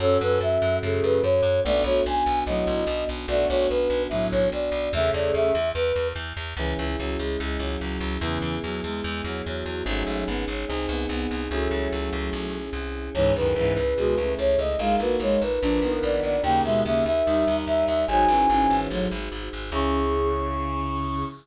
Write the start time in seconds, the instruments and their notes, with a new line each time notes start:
0.00 electric bass (finger) F#2, violin C#4 A4, electric piano 1 C#4 F#4 A4, flute C#5
0.21 electric bass (finger) F#2, violin C#4 A4, flute B4
0.40 electric bass (finger) F#2, flute E5
0.62 electric bass (finger) F#2
0.82 electric bass (finger) F#2, violin C#3 A3, flute A4
1.04 electric bass (finger) F#2, flute B4
1.23 electric bass (finger) F#2, flute C#5
1.43 electric bass (finger) F#2
1.65 electric bass (finger) B1, violin A3 F#4, electric piano 1 B3 D4 F#4, flute D5
1.84 electric bass (finger) B1, violin A3 F#4, flute C#5
2.06 electric bass (finger) B1, flute G#5
2.26 electric bass (finger) B1
2.46 electric bass (finger) B1, violin A2 F#3, flute D#5
2.67 electric bass (finger) B1
2.87 electric bass (finger) B1
3.09 electric bass (finger) B1
3.28 electric bass (finger) B1, violin A3 F#4, electric piano 1 B3 D4 F#4, flute D5
3.49 electric bass (finger) B1, violin A3 F#4, flute C#5
3.69 electric bass (finger) B1, flute B4
3.90 electric bass (finger) B1
4.09 electric bass (finger) B1, violin A2 F#3, flute E5
4.31 electric bass (finger) B1, flute C#5
4.52 electric bass (finger) B1, flute D5
4.72 electric bass (finger) B1
4.93 electric bass (finger) E2, violin C#3 A3, flute E5
5.14 electric bass (finger) E2, flute D5
5.34 electric bass (finger) E2, flute E5
5.55 electric bass (finger) E2
5.74 electric bass (finger) E2, flute B4
5.96 electric bass (finger) E2
6.16 electric bass (finger) E2
6.37 electric bass (finger) E2
6.57 electric bass (finger) C#2, violin C#3 E3, electric piano 1 C#4 E4 G#4
6.79 electric bass (finger) C#2
6.99 electric bass (finger) C#2, violin F#3
7.19 electric bass (finger) C#2, violin G#3
7.40 electric bass (finger) C#2, violin G#3
7.59 electric bass (finger) C#2, violin F#3
7.80 electric bass (finger) C#2, violin F#3
8.00 electric bass (finger) C#2
8.21 electric bass (finger) E2, violin C#3 E3, electric piano 1 B3 E4 G#4
8.42 electric bass (finger) E2
8.63 electric bass (finger) E2, violin F#3
8.84 electric bass (finger) E2, violin G#3
9.04 electric bass (finger) E2, violin G#3
9.24 electric bass (finger) E2, violin F#3
9.45 electric bass (finger) E2, violin F#3
9.66 electric bass (finger) E2
9.86 electric bass (finger) G#1, violin F#3 A3, electric piano 1 C#4 D#4 G#4
10.07 electric bass (finger) G#1
10.27 electric bass (finger) G#1, violin B3
10.48 electric bass (finger) G#1, violin C#4
10.69 electric bass (finger) C2, electric piano 1 C4 D#4 G#4, violin C4
10.89 electric bass (finger) C2, violin B3
11.08 electric bass (finger) C2, violin B3
11.31 electric bass (finger) C2
11.51 electric bass (finger) C#2, violin F#3 A3, electric piano 1 C#4 E4 G#4
11.71 electric bass (finger) C#2
11.92 electric bass (finger) C#2
12.13 electric bass (finger) C#2
12.33 electric bass (finger) B1
12.73 electric bass (finger) C2
13.14 electric bass (finger) C#2, violin G#2 E3, electric piano 1 C#4 E4 G#4, flute C#5
13.36 electric bass (finger) C#2, violin F#2 D#3, flute B4
13.55 electric bass (finger) C#2, violin G#2 E3, flute B4
13.76 electric bass (finger) C#2, flute B4
13.97 electric bass (finger) C#2, violin B2 G#3
14.18 electric bass (finger) C#2, violin C#3 A3
14.39 electric bass (finger) C#2, flute C#5
14.59 electric bass (finger) C#2, flute D#5
14.79 electric bass (finger) A#1, violin G#3 F4, electric piano 1 D#4 F4 A#4, flute F5
15.00 electric bass (finger) A#1, violin A#3 F#4, flute B4
15.20 electric bass (finger) A#1, violin G#3 F4, flute C#5
15.42 electric bass (finger) A#1, flute B4
15.62 electric bass (finger) A#1, violin F3 D4, electric piano 1 D4 F4 A#4
15.82 electric bass (finger) A#1, violin D#3 B3
16.03 electric bass (finger) A#1, flute D5
16.23 electric bass (finger) A#1, flute D5
16.43 electric bass (finger) D#2, violin C#3 A#3, electric piano 1 D#4 G4 A#4, flute G5
16.65 electric bass (finger) D#2, violin B2 G#3, flute E5
16.85 electric bass (finger) D#2, violin C#3 A#3, flute E5
17.05 electric bass (finger) D#2, flute E5
17.26 electric bass (finger) D#2, violin G3 D#4
17.46 electric bass (finger) D#2, violin G3 D#4
17.67 electric bass (finger) D#2, flute E5
17.86 electric bass (finger) D#2, flute E5
18.08 electric bass (finger) G#1, violin F#3 D#4, electric piano 1 D#4 F#4 G#4 C5, flute G#5
18.28 electric bass (finger) G#1, violin E3 C#4
18.49 electric bass (finger) G#1, violin E3 C#4
18.70 electric bass (finger) G#1
18.90 electric bass (finger) G#1, violin A2 F#3
19.11 electric bass (finger) G#1
19.32 electric bass (finger) G#1
19.53 electric bass (finger) G#1
19.72 electric bass (finger) C#2, violin C#3, electric piano 1 C#4 E4 G#4, flute C#6